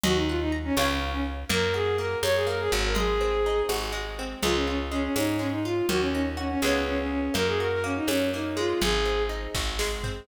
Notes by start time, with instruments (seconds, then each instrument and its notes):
0.03 electric bass (finger) D#2, violin F#4, acoustic guitar (steel) D#5, low conga
0.16 violin D#4
0.28 violin F4, acoustic guitar (steel) F#5
0.41 violin D#4
0.52 acoustic guitar (steel) A#5
0.65 violin C#4
0.77 electric bass (finger) C#2, violin C#4, acoustic guitar (steel) C#5 F5 G#5, tambourine, high conga
0.82 acoustic guitar (steel) B5
1.13 violin C#4
1.49 electric bass (finger) F#2, acoustic guitar (steel) A#3, violin A#4, low conga
1.74 acoustic guitar (steel) F#4, violin G#4
1.98 acoustic guitar (steel) A#3, violin A#4
2.23 electric bass (finger) F#2, acoustic guitar (steel) C#4, violin C#5, tambourine, high conga
2.35 violin G#4
2.47 acoustic guitar (steel) A#3, violin A#4
2.60 violin G#4
2.72 electric bass (finger) G#1, acoustic guitar (steel) F#4
2.85 violin A#4
2.95 acoustic guitar (steel) G#3, violin G#4, low conga
3.21 acoustic guitar (steel) C4
3.46 acoustic guitar (steel) D#4
3.69 electric bass (finger) G#1, acoustic guitar (steel) F#4, tambourine, high conga
3.92 acoustic guitar (steel) G#3
4.19 acoustic guitar (steel) C4
4.42 electric bass (finger) C#2, acoustic guitar (steel) G#3, violin F4, low conga
4.55 violin C#4
4.67 violin C#4, acoustic guitar (steel) F4
4.91 acoustic guitar (steel) G#3, violin C#4
5.03 violin C#4
5.16 electric bass (finger) G#2, acoustic guitar (steel) C#4, violin D#4, tambourine, high conga
5.39 acoustic guitar (steel) G#3, violin C#4
5.52 violin D#4
5.65 violin F4, acoustic guitar (steel) F4
5.89 electric bass (finger) D#2, acoustic guitar (steel) A#3, violin F#4, low conga
6.01 violin C#4
6.13 violin C#4, acoustic guitar (steel) D#4
6.37 violin C#4, acoustic guitar (steel) F#4
6.50 violin C#4
6.62 electric bass (finger) C#2, acoustic guitar (steel) G#3 B3 C#4, violin C#4, tambourine, high conga
6.67 acoustic guitar (steel) F4
6.86 violin C#4
6.99 violin C#4
7.11 violin C#4
7.34 electric bass (finger) F#2, acoustic guitar (steel) A#3, violin A#4, low conga
7.47 violin G#4
7.60 acoustic guitar (steel) F#4, violin A#4
7.71 violin A#4
7.84 acoustic guitar (steel) A#3, violin C#4
7.96 violin D#4
8.07 electric bass (finger) F#2, acoustic guitar (steel) C#4, violin C#4, tambourine, high conga
8.34 acoustic guitar (steel) A#3, violin D#4
8.57 acoustic guitar (steel) G#3, violin F4
8.81 electric bass (finger) G#1, violin G#4, low conga
9.05 acoustic guitar (steel) C4
9.29 acoustic guitar (steel) D#4
9.55 electric bass (finger) G#1, acoustic guitar (steel) F#4, kick, snare
9.79 acoustic guitar (steel) G#3, snare
10.03 acoustic guitar (steel) C4, floor tom